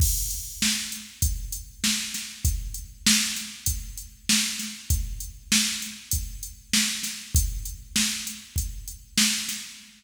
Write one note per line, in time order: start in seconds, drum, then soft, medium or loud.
0.00 kick loud
0.00 crash loud
0.30 closed hi-hat medium
0.62 snare loud
0.92 closed hi-hat medium
1.22 kick loud
1.22 closed hi-hat loud
1.52 closed hi-hat medium
1.84 snare loud
2.14 snare medium
2.14 closed hi-hat medium
2.45 kick loud
2.45 closed hi-hat loud
2.74 closed hi-hat medium
3.07 snare loud
3.36 snare soft
3.36 closed hi-hat medium
3.66 kick medium
3.66 closed hi-hat loud
3.97 closed hi-hat medium
4.29 snare loud
4.59 snare medium
4.59 closed hi-hat medium
4.90 kick loud
4.90 closed hi-hat loud
5.20 closed hi-hat medium
5.52 snare loud
5.82 closed hi-hat medium
6.11 kick medium
6.11 closed hi-hat loud
6.43 closed hi-hat medium
6.73 snare loud
7.03 snare medium
7.03 closed hi-hat medium
7.35 kick loud
7.35 closed hi-hat loud
7.65 closed hi-hat medium
7.96 snare loud
8.27 closed hi-hat medium
8.56 kick medium
8.56 closed hi-hat medium
8.88 closed hi-hat medium
9.18 snare loud
9.48 snare medium
9.48 closed hi-hat medium